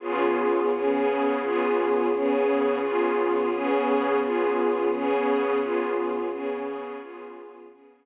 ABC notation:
X:1
M:12/8
L:1/8
Q:3/8=86
K:Db
V:1 name="String Ensemble 1"
[D,_CFA]3 [D,CDA]3 [D,CFA]3 [D,CDA]3 | [D,_CFA]3 [D,CDA]3 [D,CFA]3 [D,CDA]3 | [D,_CFA]3 [D,CDA]3 [D,CFA]3 [D,CDA]3 |]